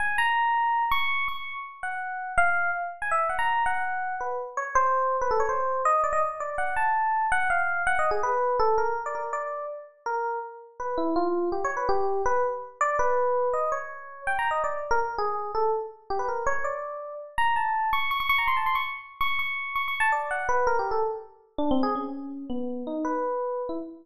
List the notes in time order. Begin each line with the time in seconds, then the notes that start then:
0.00 G#5
0.18 A#5
0.91 C#6
1.28 C#6
1.83 F#5
2.38 F5
3.02 G#5
3.11 E5
3.29 F#5
3.39 A#5
3.66 F#5
4.21 B4
4.57 C#5
4.75 C5
5.21 B4
5.31 A4
5.40 C#5
5.49 C5
5.85 D#5
6.04 D5
6.13 D#5
6.40 D5
6.58 F#5
6.76 A5
7.32 F#5
7.50 F5
7.87 F#5
7.99 D#5
8.11 G#4
8.23 B4
8.60 A4
8.78 A#4
9.06 D5
9.15 A#4
9.33 D5
10.06 A#4
10.80 B4
10.98 E4
11.16 F4
11.52 G4
11.64 C#5
11.77 B4
11.89 G4
12.26 B4
12.81 D5
12.99 B4
13.54 D#5
13.72 C#5
14.27 G5
14.39 A#5
14.51 D#5
14.64 D5
14.91 A#4
15.18 G#4
15.55 A4
16.10 G4
16.19 B4
16.29 A#4
16.47 C#5
16.64 D5
17.38 A#5
17.56 A5
17.93 C#6
18.11 C#6
18.20 C#6
18.29 C#6
18.38 A#5
18.47 C6
18.57 A5
18.66 C6
18.75 C#6
19.21 C#6
19.39 C#6
19.75 C#6
19.88 C#6
20.00 A5
20.12 D5
20.31 F#5
20.49 B4
20.67 A#4
20.79 G4
20.91 A4
21.58 D4
21.71 C4
21.83 G#4
21.95 C#4
22.50 B3
22.87 D#4
23.05 B4
23.69 E4